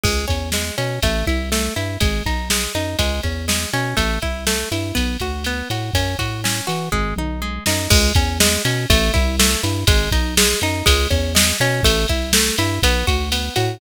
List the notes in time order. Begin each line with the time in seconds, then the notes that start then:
0.03 C#2 G#3, kick, crash
0.28 E2 C#4, kick, ride
0.52 G#3, snare
0.78 B2 C#4, ride
1.02 A1 A3, kick, ride
1.27 C2 E4, kick, ride
1.52 A3, snare
1.76 G2 E4, ride
2.00 G#1 G#3, kick, ride
2.26 B1 D#4, kick, ride
2.50 G#3, snare
2.75 F#2 D#4, ride
2.99 C#2 G#3, kick, ride
3.23 E2 C#4, kick, ride
3.48 G#3, snare
3.73 B2 C#4, ride
3.97 A1 A3, kick, ride
4.22 C2 E4, kick, ride
4.47 A3, snare
4.71 G2 E4, ride
4.95 B1 B3, kick, ride
5.20 D2 F#4, kick, ride
5.44 B3, ride
5.70 A2 F#4, ride
5.94 F#2 C#4, kick, ride
6.19 A2 F#4, kick, ride
6.44 C#4, snare
6.67 E3 F#4, ride
6.92 G#1 G#3, kick, floor tom
7.16 B1 D#4, mid tom
7.42 G#3
7.66 F#2 D#4, snare
7.90 C#2 G#3, kick, crash
8.15 E2 C#4, kick, ride
8.40 G#3, snare
8.65 B2 C#4, ride
8.90 A1 A3, kick, ride
9.14 C2 E4, kick, ride
9.39 A3, snare
9.63 G2 E4, ride
9.87 G#1 G#3, kick, ride
10.11 B1 D#4, kick, ride
10.37 G#3, snare
10.61 F#2 D#4, ride
10.86 C#2 G#3, kick, ride
11.10 E2 C#4, kick, ride
11.35 G#3, snare
11.60 B2 C#4, ride
11.83 A1 A3, kick, ride
12.08 C2 E4, kick, ride
12.33 A3, snare
12.58 G2 E4, ride
12.83 B1 B3, kick, ride
13.07 D2 F#4, kick, ride
13.32 B3, ride
13.56 A2 F#4, ride